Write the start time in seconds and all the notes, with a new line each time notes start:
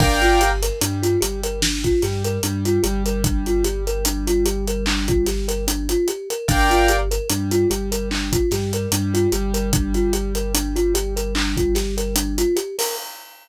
0.00 G1 D4 A#4 D5 F5 G5, kick, crash
0.22 F4, closed hi-hat
0.41 G4, closed hi-hat
0.63 A#4, closed hi-hat
0.81 G2 G3 D4, closed hi-hat
1.03 F4, closed hi-hat
1.21 G1 G3 G4, closed hi-hat
1.43 A#4, closed hi-hat
1.62 D4, snare
1.84 F4, kick, closed hi-hat
2.02 G2 G3 G4, snare, closed hi-hat
2.24 A#4, closed hi-hat
2.43 G2 G3 D4, closed hi-hat
2.65 F4, closed hi-hat
2.83 G1 G3 G4, closed hi-hat
3.06 A#4, closed hi-hat
3.24 D4, kick, closed hi-hat
3.46 F4, closed hi-hat
3.64 G4, closed hi-hat
3.87 A#4, closed hi-hat
4.05 D4, closed hi-hat
4.27 F4, closed hi-hat
4.46 G4, closed hi-hat
4.68 A#4, closed hi-hat
4.86 D4, clap
5.08 F4, kick, closed hi-hat
5.27 G4, snare, closed hi-hat
5.48 A#4, closed hi-hat
5.68 D4, closed hi-hat
5.89 F4, closed hi-hat
6.08 G4, closed hi-hat
6.30 A#4, closed hi-hat
6.48 G1 D4 A#4 D5 F5 G5, kick, closed hi-hat
6.70 F4, closed hi-hat
6.88 G4, closed hi-hat
7.11 A#4, closed hi-hat
7.30 G2 G3 D4, closed hi-hat
7.51 F4, closed hi-hat
7.70 G1 G3 G4, closed hi-hat
7.92 A#4, closed hi-hat
8.11 D4, clap
8.32 F4, kick, closed hi-hat
8.51 G2 G3 G4, snare, closed hi-hat
8.73 A#4, closed hi-hat
8.92 G2 G3 D4, closed hi-hat
9.14 F4, closed hi-hat
9.32 G1 G3 G4, closed hi-hat
9.54 A#4, closed hi-hat
9.73 D4, kick, closed hi-hat
9.94 F4, closed hi-hat
10.13 G4, closed hi-hat
10.35 A#4, closed hi-hat
10.54 D4, closed hi-hat
10.76 F4, closed hi-hat
10.94 G4, closed hi-hat
11.16 A#4, closed hi-hat
11.35 D4, clap
11.57 F4, kick, closed hi-hat
11.75 G4, snare, closed hi-hat
11.97 A#4, closed hi-hat
12.16 D4, closed hi-hat
12.38 F4, closed hi-hat
12.56 G4, closed hi-hat
12.79 A#4, open hi-hat